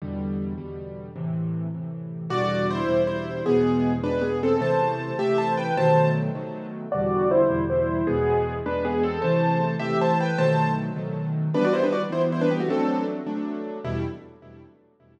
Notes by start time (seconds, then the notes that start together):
0.02 E2 B2 D3 G3
0.58 E2 B2 D3 G3
1.16 A2 C3 E3
1.74 A2 C3 E3
2.30 E2 B2 D3 G3 F#4 D5
2.70 E4 C5
2.89 E2 B2 D3 G3
3.07 E4 C5
3.46 E2 B2 G#3 B3 G#4
4.03 E2 B2 G#3 D4 B4
4.21 B3 G#4
4.43 C4 A4
4.60 C3 E3 A3 C5 A5
5.19 C3 E3 A3 G4 E5
5.38 C5 A5
5.57 B4 G5
5.77 B2 D#3 F#3 A3 C5 A5
6.35 B2 D#3 F#3 A3
6.92 E2 B2 D3 G3 F#4 D5
7.31 E4 C5
7.49 E2 B2 D3 G3
7.70 E4 C5
8.07 E2 B2 G#3 B3 G#4
8.66 E2 B2 G#3 D4 B4
8.85 B3 G#4
9.03 C4 A4
9.22 C3 E3 A3 C5 A5
9.79 C3 E3 A3 G4 E5
10.01 C5 A5
10.20 B4 G5
10.38 B2 D#3 F#3 A3 C5 A5
10.96 B2 D#3 F#3 A3
11.54 E3 G3 B3 D4 B4
11.64 F#4 D5
11.73 E4 C5
11.83 D4 B4
11.92 F#4 D5
12.10 E3 G3 B3 E4 C5
12.32 E4 C5
12.41 D4 B4
12.51 B3 G4
12.60 A3 F#4
12.68 F#3 A3 C4 D4 A4
13.27 F#3 A3 D4
13.84 E2 B2 G3 E4